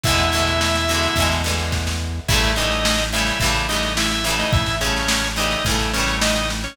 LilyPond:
<<
  \new Staff \with { instrumentName = "Drawbar Organ" } { \time 4/4 \key e \major \tempo 4 = 107 <e' e''>2~ <e' e''>8 r4. | <e' e''>8 <dis' dis''>4 <e' e''>8 r8 <dis' dis''>8 <e' e''>16 <e' e''>16 r16 <dis' dis''>16 | <e' e''>8 <cis' cis''>4 <dis' dis''>8 r8 <cis' cis''>8 <dis' dis''>16 <dis' dis''>16 r16 <cis' cis''>16 | }
  \new Staff \with { instrumentName = "Acoustic Guitar (steel)" } { \time 4/4 \key e \major <b, d e gis>8 <b, d e gis>4 <b, d e gis>8 <b, d e gis>8 <b, d e gis>4. | <cis e g a>8 <cis e g a>4 <cis e g a>8 <cis e g a>8 <cis e g a>4 <cis e g a>8~ | <cis e g a>8 <cis e g a>4 <cis e g a>8 <cis e g a>8 <cis e g a>4. | }
  \new Staff \with { instrumentName = "Synth Bass 1" } { \clef bass \time 4/4 \key e \major e,2 e,2 | a,,2 a,,2 | a,,2 a,,2 | }
  \new DrumStaff \with { instrumentName = "Drums" } \drummode { \time 4/4 <bd sn>16 sn16 sn16 sn16 sn16 sn16 sn16 sn16 <bd sn>16 sn16 sn16 sn16 <bd sn>16 sn8. | <cymc bd sn>16 sn16 sn16 sn16 sn16 sn16 sn16 sn16 <bd sn>16 sn16 sn16 sn16 sn16 sn16 sn16 sn16 | <bd sn>16 sn16 sn16 sn16 sn16 sn16 sn16 sn16 <bd sn>16 sn16 sn16 sn16 sn16 sn16 sn16 sn16 | }
>>